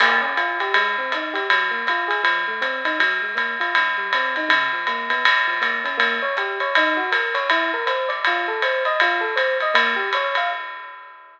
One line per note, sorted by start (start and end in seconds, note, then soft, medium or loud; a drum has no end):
0.00 0.21 A#3 medium
0.00 crash loud
0.00 ride loud
0.21 0.34 C#4 medium
0.37 0.58 F4 medium
0.37 hi-hat pedal medium
0.37 ride medium
0.60 0.74 G4 medium
0.60 ride medium
0.74 0.96 G#3 medium
0.74 ride loud
0.98 1.11 C4 medium
1.12 1.35 D#4 medium
1.12 hi-hat pedal medium
1.12 ride medium
1.34 1.47 G4 medium
1.34 ride medium
1.50 1.71 F#3 medium
1.50 ride loud
1.71 1.84 A#3 medium
1.87 2.10 F4 medium
1.87 hi-hat pedal medium
1.87 ride medium
2.08 2.21 G#4 medium
2.08 ride medium
2.23 2.44 F3 medium
2.23 ride medium
2.48 2.61 A3 medium
2.61 2.82 C4 medium
2.61 kick medium
2.61 hi-hat pedal medium
2.61 ride medium
2.85 2.98 D#4 medium
2.85 ride medium
3.00 3.20 F#3 medium
3.00 ride medium
3.22 3.35 G#3 medium
3.35 3.56 A#3 medium
3.35 kick medium
3.35 hi-hat pedal medium
3.35 ride medium
3.60 3.73 F4 medium
3.60 ride medium
3.75 3.97 G#2 medium
3.75 ride medium
3.98 4.11 G3 medium
4.13 4.35 C4 medium
4.13 hi-hat pedal medium
4.13 ride medium
4.36 4.50 D#4 medium
4.36 ride medium
4.49 4.69 C#3 medium
4.49 kick medium
4.49 ride loud
4.73 4.86 F3 medium
4.87 5.09 A#3 medium
4.87 hi-hat pedal medium
4.87 ride medium
5.10 5.23 B3 medium
5.10 ride medium
5.25 5.46 F#2 medium
5.25 ride loud
5.48 5.61 F3 medium
5.61 5.82 A#3 medium
5.61 hi-hat pedal medium
5.61 ride medium
5.84 5.97 C#4 medium
5.84 ride medium
5.98 6.18 A#3 medium
5.98 ride medium
6.22 6.35 C#5 medium
6.37 6.58 G4 medium
6.37 kick medium
6.37 hi-hat pedal medium
6.37 ride medium
6.60 6.74 C#5 medium
6.60 ride medium
6.75 6.97 D#4 medium
6.75 ride loud
6.97 7.10 F#4 medium
7.12 7.33 A#4 medium
7.12 kick medium
7.12 hi-hat pedal medium
7.12 ride medium
7.34 7.48 C#5 medium
7.34 ride medium
7.50 7.71 E4 medium
7.50 ride medium
7.74 7.87 A#4 medium
7.86 8.07 C5 medium
7.86 hi-hat pedal medium
7.86 ride medium
8.09 8.22 D5 medium
8.09 ride medium
8.25 8.48 F4 medium
8.25 kick medium
8.25 ride medium
8.48 8.61 A4 medium
8.62 8.83 C5 medium
8.62 hi-hat pedal medium
8.62 ride medium
8.85 8.99 D#5 medium
8.85 ride medium
9.00 9.22 F4 medium
9.00 ride loud
9.21 9.34 A4 medium
9.36 9.57 C5 medium
9.36 kick medium
9.36 hi-hat pedal medium
9.36 ride medium
9.60 9.75 D#5 medium
9.60 ride medium
9.74 9.95 A#3 medium
9.74 ride loud
9.96 10.09 G4 medium
10.13 10.35 C#5 medium
10.13 hi-hat pedal medium
10.13 ride medium
10.35 10.50 F5 medium
10.35 ride medium